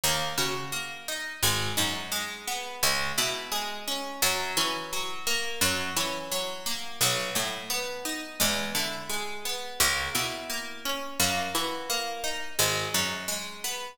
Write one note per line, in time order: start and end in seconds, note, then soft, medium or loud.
0.04 0.33 D#2 medium
0.04 0.72 A#3 loud
0.38 1.27 C#3 medium
0.38 1.38 F#4 medium
0.72 1.39 A#3 medium
1.08 1.41 D#4 medium
1.43 1.72 G#1 medium
1.43 2.11 G#3 loud
1.77 2.67 F#2 medium
1.77 2.76 D#4 medium
2.12 2.78 G#3 medium
2.48 2.81 B3 medium
2.83 3.12 C#2 medium
2.83 3.51 G#3 medium
3.18 4.07 B2 medium
3.18 4.17 E4 medium
3.52 4.18 G#3 medium
3.87 4.21 C#4 medium
4.22 4.52 F#2 medium
4.22 4.92 F#3 loud
4.57 5.46 E3 medium
4.57 5.57 C#4 medium
4.93 5.59 F#3 medium
5.27 5.60 A#3 medium
5.61 5.91 F#2 medium
5.61 6.31 F#3 medium
5.97 6.86 E3 medium
5.97 6.96 C#4 medium
6.32 6.98 F#3 medium
6.66 6.99 A#3 medium
7.01 7.30 B1 medium
7.01 8.35 F#3 loud
7.35 8.25 A2 medium
7.35 8.35 A3 medium
7.70 8.36 B3 medium
8.05 8.38 D#4 medium
8.40 8.71 E2 medium
8.40 9.09 G#3 loud
8.75 9.64 D3 medium
8.75 9.75 E4 medium
9.09 9.76 G#3 medium
9.45 9.78 B3 medium
9.80 10.10 C#2 medium
9.80 10.49 A#3 loud
10.15 11.04 B2 medium
10.15 11.14 E4 medium
10.50 11.16 A#3 medium
10.85 11.18 C#4 medium
11.20 11.49 F#2 medium
11.20 11.89 A#3 loud
11.55 12.44 E3 medium
11.55 12.55 F#4 medium
11.90 12.56 A#3 medium
12.24 12.57 D#4 medium
12.59 12.89 G#1 medium
12.59 13.27 G#3 loud
12.94 13.83 F#2 medium
12.94 13.94 D#4 medium
13.28 13.94 G#3 medium
13.64 13.97 B3 medium